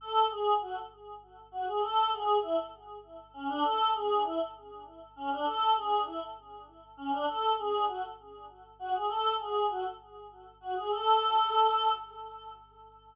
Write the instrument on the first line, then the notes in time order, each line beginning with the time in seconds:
choir aahs
0.01 A4
0.30 G#4
0.61 F#4
1.52 F#4
1.67 G#4
1.81 A4
2.12 G#4
2.42 E4
3.33 C#4
3.49 D4
3.63 A4
3.94 G#4
4.24 E4
5.16 C#4
5.31 D4
5.45 A4
5.76 G#4
6.06 E4
6.97 C#4
7.12 D4
7.28 A4
7.58 G#4
7.88 F#4
8.79 F#4
8.94 G#4
9.09 A4
9.39 G#4
9.69 F#4
10.61 F#4
10.76 G#4
10.91 A4